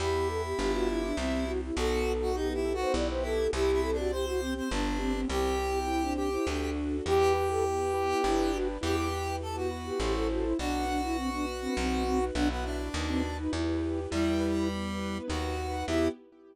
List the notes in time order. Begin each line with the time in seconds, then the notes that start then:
0.00 E2 B3 E4 G4
0.28 A4
0.44 G4
0.58 G1 B3 D4 F4 G4
0.74 F#4
0.88 E4
1.03 D4
1.17 C2 C4 E4 G4
1.47 E4 F#4
1.62 E4
1.76 B1 B3 D#4 F#4 A4
2.05 D#4
2.22 F#4
2.34 B3 D#4 F#4 G4 A4 B4
2.50 E4 G4
2.65 A4
2.74 F#4
2.81 C5
2.94 B1 B3 E4 G4 D5
3.09 C5
3.22 E4 A4
3.53 C2 C4 E4 G4
3.72 E4
3.83 G4 A4
3.93 D4
3.98 F#4
4.11 C4 E4 G4 C5
4.27 F#4
4.40 C4 G4
4.55 C4 C5
4.71 G1 B3 D4 G4
4.99 C4 G4
5.14 C4
5.28 C2 C4 E4 G4
5.59 G4
5.87 C4 E4 G4 C5
6.02 D4
6.16 G4
6.32 E4
6.47 D2 D4 F#4 A4
6.75 F#4
7.05 E2 E4 G4 B4
7.34 G4 B4
7.50 A4
7.63 B3 E4 G4 B4
7.79 G4
7.94 B4
8.08 E4
8.24 G1 D4 E4 G4 B4
8.54 F#4
8.81 E2 E4 G4 B4
9.13 B4
9.41 B3 E4 G4 A4 B4
9.55 F#4
9.71 B4
9.86 G4
10.00 A1 E4 G4 A4 C5
10.14 A4
10.30 F#4
10.44 E4
10.58 B1 D4 F#4 B4
10.88 D4 B4
11.03 E4
11.17 B3 C4 D4 F#4 B4
11.32 D4
11.47 B4
11.61 C4
11.76 B1 C4 D#4 F#4 B4
12.05 C4 B4
12.34 B1 B3 D4 E4 F#4 B4
12.50 B3
12.64 D4
12.94 D#2 D#4 F#4 B4
13.08 C4
13.24 B4
13.38 D#4
13.52 E2 E4 G4 B4
13.82 G4
14.11 E2 G3 E4 G4 B4
14.41 B4
14.69 B3 E4 G4 B4
15.00 B4
15.28 D#2 D#4 F#4 B4
15.58 B4
15.87 E2 B3 E4 G4